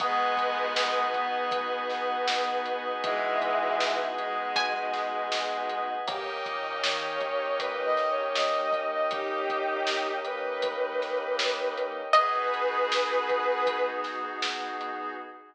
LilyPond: <<
  \new Staff \with { instrumentName = "Pizzicato Strings" } { \time 4/4 \key gis \minor \tempo 4 = 79 r1 | r2 gis''2 | r1 | r1 |
dis''1 | }
  \new Staff \with { instrumentName = "Violin" } { \time 4/4 \key gis \minor <gis b>4. b2~ b8 | <e gis>4. gis2~ gis8 | g'16 r8. cis''4 \tuplet 3/2 { b'8 dis''8 cis''8 } dis''8. dis''16 | <dis' g'>4. b'2~ b'8 |
<gis' b'>2~ <gis' b'>8 r4. | }
  \new Staff \with { instrumentName = "Electric Piano 2" } { \time 4/4 \key gis \minor <b dis' fis' gis'>1~ | <b dis' fis' gis'>1 | <ais cis' dis' g'>1~ | <ais cis' dis' g'>1 |
<b dis' fis' gis'>1 | }
  \new Staff \with { instrumentName = "Synth Bass 2" } { \clef bass \time 4/4 \key gis \minor gis,,8 gis,,8 gis,,4 gis,,16 gis,,16 gis,,8 gis,,4~ | gis,,2. cis,8 d,8 | dis,8 ais,8 dis4 dis,16 ais,16 dis,8 dis,4~ | dis,1 |
r1 | }
  \new Staff \with { instrumentName = "Pad 5 (bowed)" } { \time 4/4 \key gis \minor <b' dis'' fis'' gis''>1~ | <b' dis'' fis'' gis''>1 | <ais' cis'' dis'' g''>1~ | <ais' cis'' dis'' g''>1 |
<b dis' fis' gis'>1 | }
  \new DrumStaff \with { instrumentName = "Drums" } \drummode { \time 4/4 <hh bd>8 <hh bd>8 sn8 <hh bd>8 <hh bd>8 <hh sn>8 sn8 hh8 | <hh bd>8 <hh bd>8 sn8 hh8 <hh bd>8 <hh sn>8 sn8 hh8 | <hh bd>8 <hh bd>8 sn8 <hh bd>8 <hh bd>8 <hh sn>8 sn8 <hh bd>8 | <hh bd>8 <hh bd>8 sn8 hh8 <hh bd>8 <hh sn>8 sn8 hh8 |
<hh bd>8 hh8 sn8 <hh bd>8 <hh bd>8 <hh sn>8 sn8 hh8 | }
>>